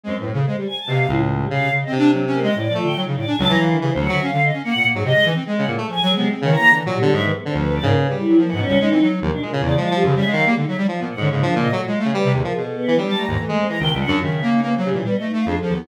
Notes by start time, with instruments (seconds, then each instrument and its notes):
0.04 lead 1 (square) F#2 G#3, choir aahs C4
0.16 lead 1 (square) A2, choir aahs B4
0.26 lead 1 (square) A2
0.33 lead 1 (square) C#3, choir aahs A4
0.46 lead 1 (square) G#3, choir aahs C5
0.56 choir aahs G3, lead 1 (square) G3
0.67 choir aahs G#5
0.78 choir aahs A5
0.87 lead 1 (square) B2 C3, choir aahs F5
0.98 choir aahs F5
1.08 lead 1 (square) C#2 A2, choir aahs E4
1.39 choir aahs G3
1.50 lead 1 (square) C3 C#3, choir aahs F5
1.72 lead 1 (square) C#3
1.81 choir aahs D#5
1.87 lead 1 (square) C4
1.92 lead 1 (square) C3, choir aahs D4
1.98 lead 1 (square) D4
2.13 lead 1 (square) F#3
2.27 lead 1 (square) C#4
2.33 choir aahs A#3
2.42 lead 1 (square) G#3, choir aahs D#5
2.55 lead 1 (square) A2, choir aahs D5
2.69 lead 1 (square) F3
2.74 lead 1 (square) A3, choir aahs F4
2.83 lead 1 (square) D3, choir aahs G5
2.96 lead 1 (square) F#3, choir aahs D#4
3.07 lead 1 (square) C#3
3.16 lead 1 (square) A2, choir aahs D5
3.27 lead 1 (square) D4, choir aahs G#5
3.38 lead 1 (square) C#2 F#3, choir aahs A5
3.49 lead 1 (square) E3, choir aahs A#5
3.59 lead 1 (square) E3, choir aahs F5
3.69 lead 1 (square) D#3, choir aahs D4
3.79 lead 1 (square) C#3 E3, choir aahs G3
3.89 choir aahs C5
3.95 lead 1 (square) D2
4.00 lead 1 (square) F#3, choir aahs F#5
4.09 lead 1 (square) D3 F#3, choir aahs E5
4.22 lead 1 (square) C#4, choir aahs F5
4.32 lead 1 (square) D3
4.44 choir aahs D#5
4.53 lead 1 (square) C#4
4.64 lead 1 (square) A#3, choir aahs F#5
4.75 lead 1 (square) A#2
4.84 lead 1 (square) A#3
4.94 lead 1 (square) G#2 F#3, choir aahs G#4
5.04 lead 1 (square) C3, choir aahs D#5
5.15 lead 1 (square) G#3
5.24 lead 1 (square) E3, choir aahs D#4
5.35 lead 1 (square) C4
5.45 lead 1 (square) G#3, choir aahs G#4
5.58 lead 1 (square) C#3, choir aahs F#5
5.67 lead 1 (square) A2 A#2, choir aahs G#4
5.77 lead 1 (square) A3, choir aahs A4
5.88 lead 1 (square) F3, choir aahs G#5
6.02 lead 1 (square) F#3
6.09 choir aahs G#3
6.16 lead 1 (square) C3 B3
6.29 lead 1 (square) C4
6.40 lead 1 (square) C#3 D#3, choir aahs C#5
6.50 lead 1 (square) E3, choir aahs A#5
6.59 lead 1 (square) A#3
6.71 lead 1 (square) D3 E3
6.85 lead 1 (square) A#2 F#3
6.92 choir aahs G3
6.98 lead 1 (square) D3 B3
7.13 lead 1 (square) G#2 F#3, choir aahs E5
7.23 lead 1 (square) D#3, choir aahs B4
7.34 choir aahs B3
7.45 lead 1 (square) D3, choir aahs C4
7.54 lead 1 (square) D2 F3, choir aahs B4
7.70 lead 1 (square) F3
7.75 choir aahs D5
7.82 lead 1 (square) G#2 C#3, choir aahs A#3
7.97 choir aahs B4
8.06 lead 1 (square) C#3 G3
8.17 lead 1 (square) G3, choir aahs E4
8.28 lead 1 (square) F#3
8.37 lead 1 (square) F3, choir aahs A#3
8.48 lead 1 (square) E3, choir aahs F#5
8.52 lead 1 (square) G#2
8.57 lead 1 (square) B2, choir aahs C#4
8.67 lead 1 (square) C#2 G3
8.80 lead 1 (square) G#3, choir aahs D#4
8.90 lead 1 (square) E3 C4
9.01 lead 1 (square) F#3
9.22 lead 1 (square) D#2 F3, choir aahs A#3
9.31 lead 1 (square) B2, choir aahs D4
9.41 lead 1 (square) A#2 G#3, choir aahs A#4
9.52 lead 1 (square) C#3, choir aahs F4
9.61 lead 1 (square) E2 C#3, choir aahs D5
9.73 lead 1 (square) F3, choir aahs F4
9.77 lead 1 (square) G#3
9.84 choir aahs A5
9.91 lead 1 (square) F3 G3, choir aahs G4
10.03 lead 1 (square) F#2 C#3, choir aahs G4
10.15 lead 1 (square) C#3 G3, choir aahs E5
10.25 lead 1 (square) G#3, choir aahs F5
10.32 lead 1 (square) D#3 F#3
10.46 lead 1 (square) G3 A#3, choir aahs G#3
10.57 lead 1 (square) D3, choir aahs D#4
10.67 lead 1 (square) F#3, choir aahs E5
10.78 lead 1 (square) G3
10.88 lead 1 (square) F3
10.99 lead 1 (square) A#2 B3
11.10 choir aahs F#5
11.17 lead 1 (square) G#2 D3, choir aahs C#4
11.30 lead 1 (square) G#2 C#3, choir aahs A#3
11.41 lead 1 (square) F3 D4, choir aahs D4
11.52 lead 1 (square) A#2, choir aahs A#3
11.56 lead 1 (square) C#3
11.62 choir aahs D#5
11.72 lead 1 (square) A#2 F#3, choir aahs A3
11.82 choir aahs F4
11.87 lead 1 (square) G#3
11.94 choir aahs F5
11.99 lead 1 (square) A3
12.05 lead 1 (square) C#3
12.13 lead 1 (square) G3, choir aahs B4
12.24 lead 1 (square) C3
12.34 lead 1 (square) D#2, choir aahs G#4
12.44 lead 1 (square) F3, choir aahs A#4
12.54 lead 1 (square) B2, choir aahs G#4
12.65 choir aahs A4
12.76 choir aahs B3
12.87 lead 1 (square) E3
12.96 lead 1 (square) F#3 G3, choir aahs D4
13.07 lead 1 (square) G3, choir aahs A5
13.17 lead 1 (square) A3, choir aahs A#5
13.28 lead 1 (square) D#2 G#2, choir aahs A#5
13.38 lead 1 (square) E3, choir aahs A3
13.48 lead 1 (square) G#3
13.52 lead 1 (square) G#3
13.58 choir aahs C4
13.67 lead 1 (square) E3 G#3, choir aahs A#5
13.79 lead 1 (square) C#2 D#3, choir aahs G5
13.90 lead 1 (square) C#2 G3, choir aahs E5
14.01 choir aahs F#5
14.07 lead 1 (square) F#2 D4, choir aahs F4
14.21 lead 1 (square) C#3 D#3, choir aahs E5
14.32 choir aahs E5
14.42 lead 1 (square) A#3
14.52 choir aahs D#4
14.62 lead 1 (square) A#3, choir aahs B3
14.73 choir aahs C5
14.77 lead 1 (square) F#3
14.84 lead 1 (square) C#3, choir aahs G3
14.91 lead 1 (square) A#2 E3
14.96 choir aahs D4
15.04 lead 1 (square) G3, choir aahs B3
15.14 choir aahs D#5
15.20 lead 1 (square) A3
15.25 choir aahs D#4
15.33 lead 1 (square) A3
15.37 choir aahs F5
15.46 lead 1 (square) F2 D4, choir aahs G#4
15.57 choir aahs A4
15.62 lead 1 (square) F3
15.69 lead 1 (square) D#2
15.74 lead 1 (square) B3, choir aahs E4